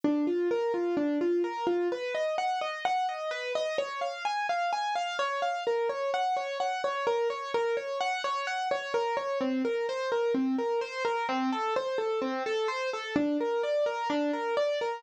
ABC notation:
X:1
M:4/4
L:1/8
Q:1/4=128
K:Bb
V:1 name="Acoustic Grand Piano"
D F B F D F B F | [K:B] B d f d f d B d | c ^e g e g e c e | A c f c f c A c |
A c f c f c A c | [K:Bb] C B c B C B c B | C A c A C A c A | D B d B D B d B |]